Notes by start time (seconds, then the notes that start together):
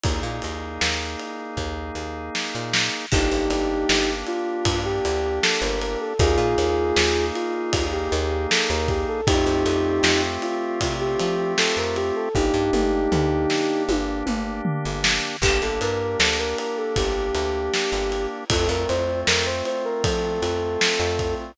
0.04 D#2 A#3 D#4 G#4, kick, ride
0.23 A#2
0.42 D#2, ride
0.81 D#2, snare
1.20 ride
1.57 D#2, kick
1.95 D#2
2.35 snare
2.55 A#2
2.74 snare
3.12 G1 A#3 D4 D#4 G4, kick, crash
3.31 G1
3.50 G1, ride
3.89 G1, snare
4.27 F4, ride
4.65 G2, kick, ride
4.85 G4
5.05 D2, ride
5.43 A4, snare
5.62 G1 A#4
5.81 A#4, ride
6.00 A4
6.19 D#2 A#3 D#4 F4 G#4, kick, ride
6.38 A#2
6.58 D#2, ride
6.96 D#2, snare
7.35 F4, ride
7.73 D#2, kick, ride
7.93 G4
8.12 D#2, ride
8.50 A4, snare
8.70 D#2 A#4
8.88 G4, kick, ride
9.08 A4
9.27 F2 A3 C4 D#4 F4 G4, kick, ride
9.46 F2
9.66 F2, ride
10.03 F2, snare
10.42 F4, ride
10.81 C3, kick, ride
11.00 G4
11.20 F3, ride
11.58 A4, snare
11.77 F2 A#4
11.96 G4, ride
12.16 A4
12.35 G1 A#3 D4 D#4 G4, kick
12.54 G2
12.73 G1, mid tom
13.12 D2, floor tom
13.50 snare
13.89 G1, high tom
14.26 G1, mid tom
14.65 floor tom
14.85 G1
15.04 snare
15.42 G1 A#3 D4 G4, kick, crash
15.62 G1 A4
15.81 G2 A#4, ride
16.20 D2 A4, snare
16.39 A#4
16.58 A#4, ride
16.77 A4
16.96 G1 G4, kick, ride
17.35 D2, ride
17.74 snare
17.92 G1
18.12 ride
18.50 F2 A3 C4 F4 A4, kick, ride
18.69 F2 A#4
18.89 F2 C5, ride
19.27 F2 A#4, snare
19.46 C5
19.65 C5, ride
19.85 A#4
20.04 F3 A4, kick, ride
20.42 F2, ride
20.81 snare
21.00 F2
21.19 kick, ride